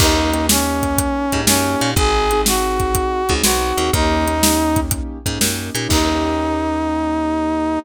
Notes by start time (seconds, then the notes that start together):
0.00 D#2 A#3 C#4 D#4 G4, kick, crash
0.33 A#3 C#4 D#4 G4, closed hi-hat
0.49 A#3 C#4 D#4 G4, snare
0.83 kick, closed hi-hat
0.98 kick, closed hi-hat
1.32 G#2 A#3 C#4 D#4 G4, kick, closed hi-hat
1.47 F#2 A#3 C#4 D#4 G4, snare
1.80 A#2 A#3 C#4 D#4 G4, closed hi-hat
1.96 G#1 C4 D#4 F#4 G#4, kick, closed hi-hat
2.31 C4 D#4 F#4 G#4, closed hi-hat
2.46 C4 D#4 F#4 G#4, snare
2.80 kick, closed hi-hat
2.95 kick, closed hi-hat
3.29 C#2 C4 D#4 F#4 G#4, kick, closed hi-hat
3.44 B1 C4 D#4 F#4 G#4, snare
3.77 D#2 C4 D#4 F#4 G#4, closed hi-hat
3.93 D#2 A#3 C#4 D#4 G4, kick, closed hi-hat
4.26 A#3 C#4 D#4 G4, closed hi-hat
4.43 A#3 C#4 D#4 G4, snare
4.76 kick, closed hi-hat
4.91 kick, closed hi-hat
5.26 G#2 A#3 C#4 D#4 G4, kick, closed hi-hat
5.40 F#2 A#3 C#4 D#4 G4, snare
5.75 A#2 A#3 C#4 D#4 G4, closed hi-hat
5.89 D#2 A#3 C#4 D#4 G4, kick, crash